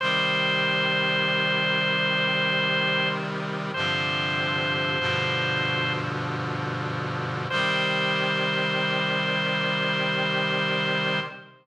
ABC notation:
X:1
M:3/4
L:1/8
Q:1/4=48
K:Cm
V:1 name="Drawbar Organ"
c6 | c4 z2 | c6 |]
V:2 name="Brass Section" clef=bass
[C,E,G,]6 | [G,,C,D,F,]2 [G,,=B,,D,F,]4 | [C,E,G,]6 |]